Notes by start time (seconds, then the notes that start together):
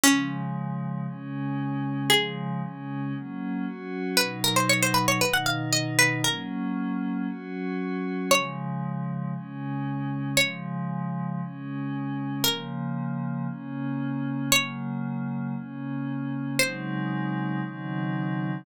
0.03 C#3 F3 G#3 C#4
1.07 C#3 G#3 C#4
2.10 C#3 F3 G#3 G#4
2.62 C#3 G#3 C#4
3.14 F#3 A#3 C#4
3.66 F#3 C#4 F#4
4.17 B2 F#3 D#4 B4
4.44 A#4
4.56 C5
4.69 C#5
4.82 C5
4.94 B4
5.08 C#5
5.21 B2 D#3 D#4 B4
5.33 F#5
5.46 F5
5.73 D#5
5.99 B4
6.24 F#3 A#3 C#4 A#4
7.28 F#3 C#4 F#4
8.31 C#3 F3 G#3 C#5
9.34 C#3 G#3 C#4
10.37 C#3 F3 G#3 C#5
11.41 C#3 G#3 C#4
12.44 C#3 F3 A#3 A#4
13.48 C#3 A#3 C#4
14.52 C#3 F#3 A#3 C#5
15.55 C#3 A#3 C#4
16.59 C#3 F#3 G#3 C4 D#4 C5
17.62 C#3 D#3 F#3 C4 D#4